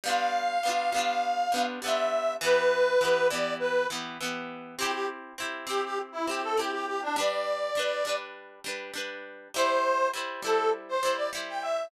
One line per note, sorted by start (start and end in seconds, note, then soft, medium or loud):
0.04 0.58 G3 medium
0.04 0.58 B3 medium
0.04 0.58 D4 medium
0.04 1.63 F5 loud
0.09 0.58 F4 medium
0.63 0.90 G3 medium
0.63 0.90 B3 medium
0.63 0.90 D4 medium
0.69 0.90 F4 medium
0.92 1.47 G3 medium
0.92 1.47 B3 medium
0.92 1.47 D4 medium
0.98 1.47 F4 medium
1.52 1.79 G3 medium
1.52 1.79 B3 medium
1.52 1.79 D4 medium
1.58 1.79 F4 medium
1.82 2.37 G3 medium
1.82 2.37 B3 medium
1.82 2.37 D4 medium
1.82 2.33 E5 medium
1.88 2.37 F4 medium
2.41 2.96 E3 loud
2.41 2.96 B3 medium
2.41 2.96 G4 medium
2.41 3.27 B4 loud
3.01 3.28 E3 medium
3.01 3.28 B3 medium
3.01 3.28 G4 medium
3.30 3.85 E3 medium
3.30 3.85 B3 medium
3.30 3.54 D5 loud
3.34 3.85 G4 medium
3.59 3.87 B4 medium
3.90 4.17 E3 medium
3.90 4.17 B3 medium
3.90 4.17 G4 medium
4.21 4.75 E3 medium
4.21 4.75 B3 medium
4.21 4.75 G4 medium
4.78 5.33 C4 medium
4.78 5.33 E4 medium
4.78 4.91 G4 loud
4.82 5.33 G4 loud
4.92 5.06 G4 loud
5.38 5.65 C4 medium
5.38 5.65 E4 medium
5.38 5.65 G4 medium
5.67 6.21 C4 medium
5.67 6.21 E4 medium
5.67 5.81 G4 loud
5.67 6.21 G4 medium
5.84 5.99 G4 loud
6.12 6.26 E4 medium
6.27 6.55 C4 medium
6.27 6.55 E4 medium
6.27 6.41 G4 medium
6.31 6.55 G4 medium
6.43 6.57 A4 medium
6.57 7.12 C4 medium
6.57 7.12 E4 medium
6.57 6.71 G4 medium
6.57 7.12 G4 medium
6.72 6.86 G4 loud
6.86 7.00 G4 loud
7.02 7.16 D4 loud
7.16 7.71 G3 loud
7.16 7.71 D4 medium
7.16 7.71 B4 medium
7.16 8.15 D5 loud
7.75 8.02 G3 medium
7.75 8.02 D4 medium
7.75 8.02 B4 medium
8.05 8.60 G3 medium
8.05 8.60 D4 medium
8.05 8.60 B4 medium
8.64 8.91 G3 medium
8.64 8.91 D4 medium
8.64 8.91 B4 medium
8.94 9.48 G3 medium
8.94 9.48 D4 medium
8.94 9.48 B4 medium
9.54 10.09 G3 medium
9.54 10.09 E4 loud
9.54 10.08 C5 loud
9.54 10.09 C5 medium
10.13 10.41 G3 medium
10.13 10.41 E4 medium
10.13 10.41 C5 medium
10.42 10.97 G3 medium
10.42 10.97 E4 medium
10.42 10.70 A4 loud
10.42 10.97 C5 medium
10.88 11.13 C5 loud
11.03 11.30 G3 medium
11.03 11.30 E4 medium
11.03 11.30 C5 medium
11.16 11.30 D5 medium
11.33 11.87 G3 medium
11.33 11.87 E4 medium
11.33 11.87 C5 medium
11.48 11.62 G5 medium
11.61 11.85 E5 medium